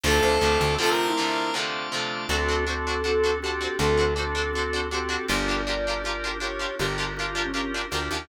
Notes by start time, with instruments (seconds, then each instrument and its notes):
0.04 electric bass (finger) D2, overdriven guitar C3 D3 F3 A3, drawbar organ A3 C4 D4 F4 C5 D5 F5 A5, flute A4, lead 1 (square) A4
0.23 electric bass (finger) D2, flute C5
0.41 electric bass (finger) D2, overdriven guitar C3 D3 F3 A3
0.61 electric bass (finger) D2
0.78 overdriven guitar C3 D3 F3 A3, drawbar organ A3 C4 D4 F4 C5 D5 F5 A5, flute F4, lead 1 (square) A4
0.90 lead 1 (square) A#4
1.07 flute E4
1.17 overdriven guitar C3 D3 F3 A3
1.53 overdriven guitar C3 D3 F3 A3, drawbar organ A3 C4 D4 F4 C5 D5 F5 A5
1.92 overdriven guitar C3 D3 F3 A3
2.29 electric bass (finger) D2, drawbar organ C4 D4 F#4 A4, overdriven guitar D4 F#4 A4 C5, flute A4
2.48 overdriven guitar D4 F#4 A4 C5
2.67 drawbar organ C4 D4 F#4 A4, overdriven guitar D4 F#4 A4 C5
2.87 overdriven guitar D4 F#4 A4 C5
3.04 drawbar organ C4 D4 F#4 A4, overdriven guitar D4 F#4 A4 C5
3.24 overdriven guitar D4 F#4 A4 C5
3.42 drawbar organ C4 D4 F#4 A4, overdriven guitar D4 F#4 A4, flute G4
3.47 overdriven guitar C5
3.61 overdriven guitar D4 F#4 A4 C5
3.79 electric bass (finger) D2, drawbar organ C4 D4 F#4 A4, overdriven guitar D4 F#4 A4 C5, flute A4
3.97 overdriven guitar D4 F#4 A4 C5
4.16 drawbar organ C4 D4 F#4 A4, overdriven guitar D4 F#4 A4 C5
4.35 overdriven guitar D4 F#4 A4 C5
4.53 drawbar organ C4 D4 F#4 A4, overdriven guitar D4 F#4 A4
4.58 overdriven guitar C5
4.73 overdriven guitar D4 F#4 A4 C5
4.91 drawbar organ C4 D4 F#4 A4, overdriven guitar D4 F#4 A4 C5, flute G4
5.09 overdriven guitar D4 F#4 A4 C5
5.28 electric bass (finger) G1, drawbar organ D4 F4 G4 A#4, overdriven guitar D4 F4 G4 A#4, flute D5
5.48 overdriven guitar D4 F4 G4 A#4
5.67 overdriven guitar D4 F4 G4 A#4, drawbar organ D4 F4 G4 A#4
5.87 overdriven guitar D4 F4 G4 A#4
6.04 drawbar organ D4 F4 G4 A#4, overdriven guitar D4 F4 G4
6.08 overdriven guitar A#4
6.24 overdriven guitar D4 F4 G4 A#4
6.40 overdriven guitar D4 F4 G4 A#4, drawbar organ D4 F4 G4 A#4, flute C#5
6.59 overdriven guitar D4 F4 G4 A#4
6.79 electric bass (finger) G1, overdriven guitar D4 F4 G4 A#4, drawbar organ D4 F4 G4 A#4, flute G4
6.98 overdriven guitar D4 F4 G4 A#4
7.17 drawbar organ D4 F4 G4 A#4, overdriven guitar D4 F4, flute F4
7.21 overdriven guitar G4 A#4
7.26 flute F4
7.35 overdriven guitar D4 F4 G4 A#4
7.45 flute C#4
7.53 drawbar organ D4 F4 G4 A#4, overdriven guitar D4 F4 G4 A#4
7.74 overdriven guitar D4 F4 G4 A#4
7.91 electric bass (finger) D2, drawbar organ D4 F4 G4 A#4, overdriven guitar D4 F4 G4 A#4
8.11 electric bass (finger) D#2, overdriven guitar D4 F4 G4 A#4